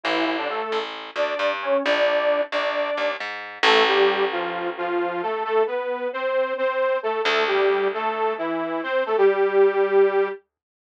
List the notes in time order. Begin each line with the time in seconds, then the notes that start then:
0.03 A1 E3 E4
0.26 E3 E4
0.37 D3 D4
0.49 A3 A4
0.72 A1
1.16 D2 D4 D5
1.39 G2
1.62 C#4 C#5
1.84 A#1 D4 D5
2.52 A#1 D4 D5
2.97 D#2
3.20 G#2
3.63 A1 A3 A4
3.87 G3 G4
4.31 F3 F4
4.77 F3 F4
5.23 A3 A4
5.44 A3 A4
5.67 B3 B4
6.13 C4 C5
6.57 C4 C5
7.03 A3 A4
7.25 D2 A3 A4
7.47 G3 G4
7.94 A3 A4
8.38 E3 E4
8.83 C4 C5
9.06 A3 A4
9.17 G3 G4